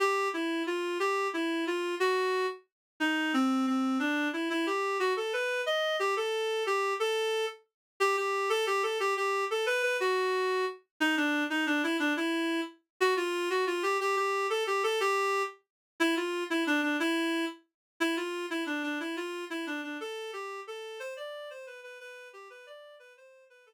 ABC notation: X:1
M:6/8
L:1/8
Q:3/8=120
K:Am
V:1 name="Clarinet"
G2 E2 F2 | G2 E2 F2 | ^F3 z3 | ^D2 C2 C2 |
D2 E E G2 | ^F A B2 ^d2 | G A3 G2 | A3 z3 |
G G2 A G A | G G2 A B B | ^F4 z2 | ^D =D2 ^D =D E |
D E3 z2 | ^F ^E2 F =F G | G G2 A G A | G3 z3 |
[K:C] E F2 E D D | E3 z3 | E F2 E D D | E F2 E D D |
A2 G2 A2 | c d2 c B B | B2 G B d2 | B c2 B A z |]